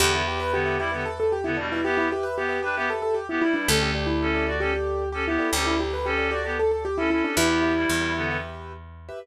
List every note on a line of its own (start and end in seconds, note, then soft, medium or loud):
0.00 3.39 E2 loud
0.00 0.22 D3 medium
0.00 0.22 B3 medium
0.00 0.11 G4 loud
0.00 0.12 G4 medium
0.00 0.11 B4 medium
0.00 0.11 E5 medium
0.14 0.27 E4 medium
0.14 0.25 G4 medium
0.14 0.25 B4 medium
0.14 0.25 E5 medium
0.27 0.59 G4 medium
0.27 0.40 G4 medium
0.27 0.59 B4 medium
0.27 0.59 E5 medium
0.40 0.52 B4 medium
0.52 0.78 D3 medium
0.52 0.78 B3 medium
0.52 0.79 G4 medium
0.65 0.76 G4 medium
0.65 0.76 B4 medium
0.65 0.76 E5 medium
0.79 0.91 G3 medium
0.79 0.91 E4 medium
0.79 1.04 G4 medium
0.79 0.90 G4 medium
0.79 0.90 B4 medium
0.79 0.90 E5 medium
0.92 1.04 D3 medium
0.92 1.04 B3 medium
0.92 1.34 G4 medium
0.92 1.34 B4 medium
0.92 1.34 E5 medium
1.05 1.18 A4 medium
1.20 1.32 A4 medium
1.32 1.45 G4 medium
1.44 1.57 D3 medium
1.44 1.57 B3 medium
1.44 1.57 E4 medium
1.57 1.80 B2 medium
1.57 1.80 G3 medium
1.57 1.69 D4 medium
1.72 1.84 E4 medium
1.72 1.94 G4 medium
1.72 1.94 B4 medium
1.72 1.94 E5 medium
1.84 2.08 B3 medium
1.84 2.08 G4 medium
1.84 1.97 G4 medium
1.97 2.10 E4 medium
1.97 2.08 G4 medium
1.97 2.08 B4 medium
1.97 2.08 E5 medium
2.11 2.43 G4 medium
2.11 2.25 G4 medium
2.11 2.43 B4 medium
2.11 2.43 E5 medium
2.23 2.36 B4 medium
2.37 2.59 B3 medium
2.37 2.59 G4 medium
2.37 2.62 G4 medium
2.49 2.59 G4 medium
2.49 2.59 B4 medium
2.49 2.59 E5 medium
2.63 2.75 D4 medium
2.63 2.86 G4 medium
2.63 2.74 G4 medium
2.63 2.75 B4 medium
2.63 2.74 B4 medium
2.63 2.74 E5 medium
2.76 2.89 B3 medium
2.76 2.89 G4 medium
2.76 3.20 G4 medium
2.76 3.20 B4 medium
2.76 3.20 E5 medium
2.90 3.02 A4 medium
3.02 3.15 A4 medium
3.14 3.27 G4 medium
3.29 3.42 B3 medium
3.29 3.41 E4 medium
3.29 3.42 G4 medium
3.42 3.67 G3 medium
3.42 3.54 E4 medium
3.42 3.67 E4 medium
3.54 3.66 D4 medium
3.54 3.66 G4 medium
3.54 3.66 B4 medium
3.54 3.66 E5 medium
3.68 5.38 D2 loud
3.68 3.91 C#4 medium
3.68 3.79 G4 medium
3.68 3.91 A4 medium
3.68 3.79 A4 medium
3.68 3.83 A4 medium
3.68 3.79 D5 medium
3.80 3.90 G4 medium
3.80 3.94 G4 medium
3.80 3.90 A4 medium
3.80 3.90 D5 medium
3.95 4.07 G4 medium
3.95 4.26 G4 medium
3.95 4.26 A4 medium
3.95 4.26 D5 medium
4.07 4.49 E4 medium
4.21 4.46 C#4 medium
4.21 4.46 A4 medium
4.34 4.45 G4 medium
4.34 4.45 A4 medium
4.34 4.45 D5 medium
4.47 4.60 F#4 medium
4.47 4.57 G4 medium
4.47 4.57 A4 medium
4.47 4.57 D5 medium
4.47 4.60 D5 medium
4.60 4.73 C#4 medium
4.60 4.72 G4 medium
4.60 5.04 G4 medium
4.60 4.73 A4 medium
4.60 5.04 A4 medium
4.60 5.04 D5 medium
4.73 5.09 G4 medium
5.12 5.26 C#4 medium
5.12 5.25 G4 medium
5.12 5.26 A4 medium
5.27 5.48 B3 medium
5.27 5.51 E4 medium
5.27 5.48 G4 medium
5.39 5.60 G4 medium
5.39 5.60 A4 medium
5.39 5.60 D5 medium
5.53 7.22 D2 loud
5.53 5.74 C#4 medium
5.53 5.65 G4 medium
5.53 5.74 A4 medium
5.65 5.79 E4 medium
5.65 5.76 G4 medium
5.65 5.76 A4 medium
5.65 5.76 D5 medium
5.78 6.10 G4 medium
5.78 5.93 G4 medium
5.78 6.10 A4 medium
5.78 6.10 D5 medium
5.93 6.06 B4 medium
6.05 6.30 C#4 medium
6.05 6.28 G4 medium
6.05 6.30 A4 medium
6.18 6.28 G4 medium
6.18 6.28 A4 medium
6.18 6.28 D5 medium
6.30 6.44 F#4 medium
6.30 6.52 G4 medium
6.30 6.42 G4 medium
6.30 6.42 A4 medium
6.30 6.44 D5 medium
6.30 6.42 D5 medium
6.45 6.57 B3 medium
6.45 6.87 G4 medium
6.45 6.57 G4 medium
6.45 6.87 A4 medium
6.45 6.87 D5 medium
6.59 6.71 A4 medium
6.71 6.84 A4 medium
6.85 6.97 G4 medium
6.98 7.10 C#4 medium
6.98 7.10 E4 medium
6.98 7.10 A4 medium
7.10 7.35 C#4 medium
7.10 7.23 E4 medium
7.10 7.35 A4 medium
7.24 7.37 D4 medium
7.24 7.36 G4 medium
7.24 7.36 A4 medium
7.24 7.36 D5 medium
7.37 7.85 E2 loud
7.37 7.72 B3 medium
7.37 8.29 E4 medium
7.37 7.72 G4 medium
7.37 7.47 G4 medium
7.37 7.47 B4 loud
7.37 7.47 E5 medium
7.49 7.60 G4 medium
7.49 7.60 B4 medium
7.49 7.60 E5 medium
7.62 7.93 G4 medium
7.62 7.93 B4 medium
7.62 7.93 E5 medium
7.76 8.12 G3 medium
7.76 8.12 E4 medium
7.89 9.11 E2 medium
8.01 8.12 G4 medium
8.01 8.12 B4 medium
8.01 8.12 E5 medium
8.14 8.37 D3 medium
8.14 8.37 B3 medium
8.14 8.24 G4 medium
8.14 8.24 B4 medium
8.14 8.24 E5 medium
8.31 8.73 G4 medium
8.31 8.73 B4 medium
8.31 8.73 E5 medium
9.09 9.19 G4 medium
9.09 9.19 B4 medium
9.09 9.19 E5 medium